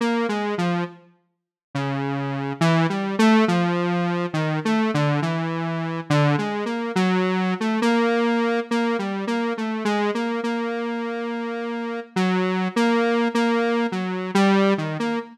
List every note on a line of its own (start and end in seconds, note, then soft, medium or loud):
0.01 0.27 A#3 medium
0.29 0.55 G#3 medium
0.58 0.84 F3 medium
1.75 2.53 C#3 medium
2.61 2.87 E3 loud
2.89 3.16 G3 medium
3.19 3.45 A3 loud
3.48 4.26 F3 medium
4.34 4.60 D#3 medium
4.65 4.91 A3 medium
4.94 5.20 D3 medium
5.22 6.00 E3 medium
6.10 6.36 D3 loud
6.38 6.64 G#3 medium
6.66 6.92 A#3 medium
6.95 7.54 F#3 medium
7.60 7.80 A3 medium
7.82 8.60 A#3 medium
8.71 8.97 A#3 medium
8.99 9.25 G3 medium
9.27 9.53 A#3 medium
9.57 9.84 A3 medium
9.85 10.11 G#3 medium
10.14 10.41 A#3 medium
10.43 12.00 A#3 medium
12.16 12.68 F#3 medium
12.76 13.28 A#3 medium
13.34 13.87 A#3 medium
13.92 14.31 F#3 medium
14.35 14.74 G3 loud
14.78 14.97 D#3 medium
14.99 15.19 A#3 medium